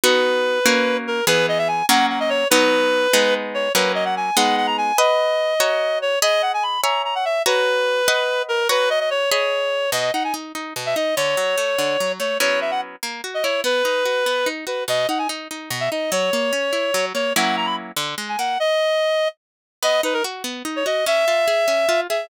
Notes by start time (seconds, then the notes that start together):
0.04 B3 D#4 F#4 B4
0.66 A#3 C#4 F#4
1.07 A#4
1.27 E3 B3 G#4 B4
1.48 D#5
1.58 E5
1.68 G#5
1.89 F#3 A#3 C#4 F#5
2.09 F#5
2.20 D#5
2.30 C#5
2.50 F#3 B3 D#4 B4
3.13 G#3 B3 D#4
3.54 C#5
3.74 F#3 A#3 C#4 B4
3.95 D#5
4.05 F#5
4.16 G#5
4.37 G#3 B3 D#4 F#5
4.57 F#5
4.67 A#5
4.78 G#5
4.98 B4 D#5 F#5
5.60 F#4 C#5 A#5
6.02 C#5
6.22 G#4 D#5 B5
6.42 F#5
6.54 G#5
6.63 B5
6.83 C#5 E5 G#5 A#5
7.05 A#5
7.15 F#5
7.25 E5
7.46 F#4 B4 C#5 A#5
8.08 B4 D#5 F#5
8.49 A#4
8.69 F#4 B4 C#5 A#5
8.90 D#5
9.00 D#5
9.10 C#5
9.31 G#4 C#5 D#5 B5
9.92 B2 D#5
10.13 D#4 F#5
10.24 G#5
10.34 D#4
10.55 D#4
10.76 B2
10.86 E5
10.96 D#4 D#5
11.16 D3 C#5
11.37 F#3
11.58 A3
11.78 D3
12.00 F#3
12.20 A3 C#5
12.40 F#3 B3 C#4 E4 C#5
12.61 E5
12.71 F#5
13.03 A#3
13.24 F#4
13.34 D#5
13.43 E4 C#5
13.64 B3 B4
13.85 D#4
14.05 F#4
14.26 B3
14.46 D#4
14.67 F#4 B4
14.88 B2 D#5
15.09 D#4 F#5
15.18 G#5
15.29 D#4
15.51 D#4
15.70 B2
15.80 E5
15.91 D#4 D#5
16.12 F#3 C#5
16.33 A#3
16.53 C#4
16.73 E4
16.94 F#3
17.14 A#3 C#5
17.36 F#3 A#3 C#4 E4 F#5
17.57 A#5
17.66 B5
17.96 D3
18.18 G#3
18.29 G#5
18.39 A#3 F#5
18.60 D#5
19.83 B3 D#5
20.03 D#4 B4
20.14 A#4
20.24 F#4
20.44 B3
20.65 D#4
20.76 C#5
20.86 F#4 D#5
21.06 C#4 E5
21.28 F4
21.48 G#4
21.68 C#4
21.89 F4
22.09 G#4 E5